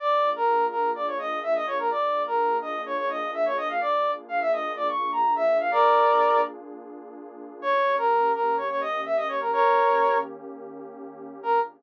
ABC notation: X:1
M:4/4
L:1/16
Q:1/4=126
K:Bbmix
V:1 name="Brass Section"
d3 B3 B2 d _d e2 _f e d B | d3 B3 e2 _d d e2 =e d _e f | d3 z f _f e2 d _d'2 b2 =e2 =f | [Bd]6 z10 |
_d3 B3 B2 d d e2 _f e d B | [B_d]6 z10 | B4 z12 |]
V:2 name="Pad 2 (warm)"
[B,DFA]16 | [B,DFA]16 | [B,DFA]16 | [B,DFA]16 |
[E,B,_DG]16 | [E,B,_DG]16 | [B,DFA]4 z12 |]